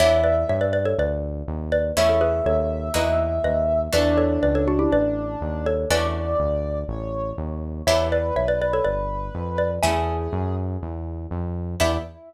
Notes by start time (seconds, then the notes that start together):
0.00 E2 B3 D4 E4 G4 C#5 E5
0.24 B4 D5
0.49 G2 C#5 E5
0.61 B4 D5
0.73 B4 D5
0.85 A4 C#5
0.98 D2 B4 D5
1.48 D#2
1.72 B4 D5
1.96 E2 A3 C#4 E4 G#4 C#5 E5
2.09 A4 C#5
2.21 G#4 B4
2.46 D#2 A4 C#5
2.94 E2 A#3 D#4 E4 F#4 B4 D#5
3.44 D#2 B4 D#5
3.93 E2 A3 B3 D4 F#4 B4 D5
4.18 A4 C#5
4.43 C#2 B4 D5
4.55 A4 C#5
4.68 D4 F#4
4.79 E4 G4
4.92 A1 B4 D5
5.41 D#2
5.66 A4 C#5
5.90 E2 A3 C#4 D4 F#4 B4 D5
6.39 D2
6.88 A1 C#5
7.38 D#2
7.86 E2 B3 D4 E4 G4 B4 C#5 E5
8.12 B4 D5
8.36 B1 C#5 E5
8.48 B4 D5
8.61 B4 D5
8.73 A4 C#5
8.84 G1 B4 D5
9.35 F2
9.58 B4 D5
9.83 E2 A3 C#4 E4 G#4 E5 G#5
10.33 F#2
10.82 E2
11.31 F2
11.80 E2 B3 D4 E4 G4 E5